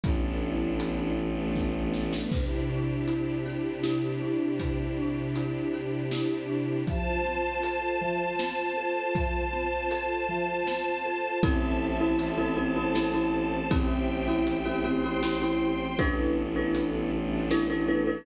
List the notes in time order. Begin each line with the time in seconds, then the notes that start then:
0.03 A1 B3 D4 E4 A4, kick, closed hi-hat
0.80 closed hi-hat
1.18 A3 B3 D4 A4
1.56 kick, snare
1.94 snare
2.13 snare
2.31 C3 D4 E4 G4, kick, crash
2.69 D4
3.08 E4, closed hi-hat
3.46 G4
3.83 E4, snare
4.22 D4
4.59 C3, kick, closed hi-hat
4.97 D4
5.35 E4, closed hi-hat
5.73 G4
6.11 E4, snare
6.50 D4
6.87 F3 F4 C5 A5, kick, closed hi-hat
7.25 C4
7.63 A4, closed hi-hat
8.01 F3
8.39 C4, snare
8.77 A4
9.15 F3, kick, closed hi-hat
9.53 C4
9.91 A4, closed hi-hat
10.29 F3
10.67 C4, snare
11.05 A4
11.43 A1 C4 E4 A4 C5 E5 A5, kick, closed hi-hat
12.00 C4 E4 A4
12.19 A1, closed hi-hat
12.38 C4 E4 A4
12.57 C4 E4 A4 C5 A5
12.76 C4 E4 A4
12.95 C4 E4 A4, snare
13.14 C4 E4 A4
13.71 A1 C4 E4 G4 C5 E5 G5, kick, closed hi-hat
14.28 C4 E4 G4
14.47 A1, closed hi-hat
14.66 C4 E4 G4
14.84 C4 E4 G4 C5 G5 C6
15.04 C4 E4 G4
15.23 C4 E4 G4, snare
15.42 C4 E4 G4
15.98 A1 B3 D4 E4 A4 B4, kick, closed hi-hat
16.56 D4 E4 A4 B4
16.75 closed hi-hat
17.12 A3 B3 D4 A4
17.51 D4 E4 A4 B4, snare
17.70 D4 E4 A4 B4
17.88 D4 E4 A4 B4
18.07 D4 E4 A4 B4